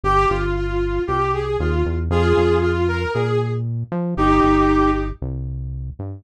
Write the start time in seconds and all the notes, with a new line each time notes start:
0.03 G1 G4
0.29 G1 F4
0.56 F4
1.07 C2 G4
1.33 G#4
1.59 D#2 F4
1.85 E2
2.10 F2 F4 G#4
2.37 F2
2.62 F4
2.88 A#4
3.14 A#2 G#4
3.92 F3
4.17 G1 D#4 G4
4.43 G1
5.22 C2
5.99 G2